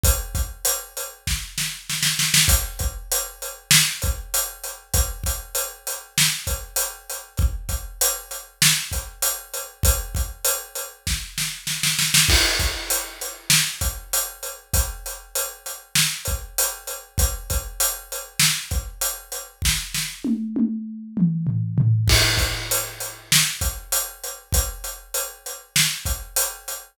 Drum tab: CC |----------------|----------------|----------------|----------------|
HH |x-x-x-x---------|x-x-x-x---x-x-x-|x-x-x-x---x-x-x-|x-x-x-x---x-x-x-|
SD |--------o-o-oooo|--------o-------|--------o-------|--------o-------|
T1 |----------------|----------------|----------------|----------------|
T2 |----------------|----------------|----------------|----------------|
FT |----------------|----------------|----------------|----------------|
BD |o-o-----o-------|o-o-------o-----|o-o-------o-----|o-o-------o-----|

CC |----------------|x---------------|----------------|----------------|
HH |x-x-x-x---------|--x-x-x---x-x-x-|x-x-x-x---x-x-x-|x-x-x-x---x-x-x-|
SD |--------o-o-oooo|--------o-------|--------o-------|--------o-------|
T1 |----------------|----------------|----------------|----------------|
T2 |----------------|----------------|----------------|----------------|
FT |----------------|----------------|----------------|----------------|
BD |o-o-----o-------|o-o-------o-----|o---------o-----|o-o-------o-----|

CC |----------------|x---------------|----------------|
HH |----------------|--x-x-x---x-x-x-|x-x-x-x---x-x-x-|
SD |o-o-------------|--------o-------|--------o-------|
T1 |----o-o---------|----------------|----------------|
T2 |----------o-----|----------------|----------------|
FT |------------o-o-|----------------|----------------|
BD |o---------------|o-o-------o-----|o---------o-----|